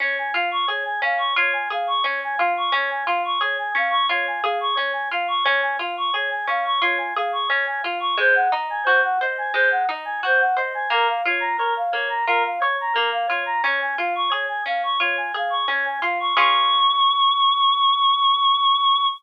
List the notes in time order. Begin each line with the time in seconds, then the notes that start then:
0.00 C#4 C#5
0.18 G#5
0.33 F4 F5
0.51 C#6
0.67 G#4 C#5
0.85 G#5
1.02 C#4 F5
1.18 C#6
1.36 F4 C#5
1.53 G#5
1.70 G#4 F5
1.87 C#6
2.03 C#4 C#5
2.24 G#5
2.37 F4 F5
2.57 C#6
2.72 C#4 C#5
2.90 G#5
3.06 F4 F5
3.25 C#6
3.40 G#4 C#5
3.59 G#5
3.75 C#4 F5
3.90 C#6
4.09 F4 C#5
4.27 G#5
4.43 G#4 F5
4.60 C#6
4.75 C#4 C#5
4.93 G#5
5.11 F4 F5
5.28 C#6
5.44 C#4 C#5
5.62 G#5
5.79 F4 F5
5.97 C#6
6.13 G#4 C#5
6.31 G#5
6.47 C#4 F5
6.65 C#6
6.82 F4 C#5
6.98 G#5
7.16 G#4 F5
7.32 C#6
7.48 C#4 C#5
7.66 G#5
7.83 F4 F5
8.00 C#6
8.17 G#3 C5
8.35 F#5
8.52 D#4 D#5
8.70 G#5
8.84 F#4 C5
9.03 F#5
9.21 C5 D#5
9.38 G#5
9.54 G#3 C5
9.71 F#5
9.89 D#4 D#5
10.05 G#5
10.23 F#4 C5
10.39 F#5
10.57 C5 D#5
10.74 G#5
10.90 A#3 A#4
11.08 F5
11.25 F4 C#5
11.40 A#5
11.58 A#4 C#5
11.77 F5
11.92 A#3 C#5
12.09 A#5
12.27 F4 A#4
12.45 F5
12.60 C#5
12.81 A#5
12.93 A#3 A#4
13.12 F5
13.27 F4 C#5
13.46 A#5
13.63 C#4 C#5
13.82 G#5
13.98 F4 F5
14.15 C#6
14.30 G#4 C#5
14.48 G#5
14.66 C#4 F5
14.83 C#6
15.00 F4 C#5
15.17 G#5
15.34 G#4 F5
15.50 C#6
15.68 C#4 C#5
15.85 G#5
16.02 F4 F5
16.20 C#6
16.37 C#4 F4 G#4 C#6